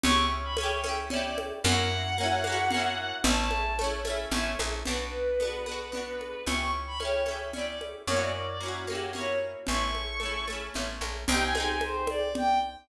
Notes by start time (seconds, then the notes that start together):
0.04 C#2 C#4 E4 C#6, low conga
0.09 G4
0.44 B5
0.57 C#4 C#5, high conga
0.61 E4 G4
0.84 C#4 E4, high conga
0.89 G4
1.10 C#4 E4 D5, low conga
1.16 G4
1.24 D5
1.38 high conga
1.64 F#2 A#3 C#4 F#5, low conga
1.69 E4 F#4
2.18 A#3 C#4
2.23 E4 F#4
2.44 A#3 C#4, high conga
2.50 E4 F#4
2.71 A#3 C#4, low conga
2.77 E4 F#4
3.24 A1 A3 C#4 A5, low conga
3.30 E4
3.39 A5
3.51 high conga
3.79 A3 C#4, high conga
3.84 E4
4.05 A3 C#4, high conga
4.10 E4
4.31 A1 A3 C#4, low conga
4.37 E4
4.59 A#1, high conga
4.85 B1 B3 D4 B4, low conga
4.91 F#4
5.40 B3 D4, high conga
5.45 F#4
5.66 B3 D4, high conga
5.72 F#4
5.92 B3 D4, low conga
5.97 F#4
6.21 high conga
6.46 C#2 C#4 E4 C#6, low conga
6.52 G4
6.87 B5
7.00 C#4 E4 C#5, high conga
7.05 G4
7.26 C#4 E4, high conga
7.31 G4
7.53 C#4 E4 D5, low conga
7.59 G4
7.67 D5
7.81 high conga
8.07 F#2 A#3 C#4 C#5, low conga
8.14 E4 F#4
8.21 D5
8.34 D5
8.48 D5
8.60 A#3 C#4 F#4
8.66 E4 F#4
8.87 A#3 C#4 G4, high conga
8.93 E4 F#4
9.13 A#3 C#4 C#5, low conga
9.18 E4 F#4
9.67 A1 A3 C#6, low conga
9.71 C#4 E4
9.95 high conga
10.20 A3 C#4, high conga
10.26 E4
10.47 A3 C#4, high conga
10.53 E4
10.74 A1 A3 C#4, low conga
10.79 E4
11.01 A#1, high conga
11.28 C2 C4 D#4 G5, low conga
11.34 G4
11.42 G#5
11.55 C4 D#4 G#5, high conga
11.60 G4
11.69 G#5
11.81 C5, high conga
12.07 D5, high conga
12.35 G5, low conga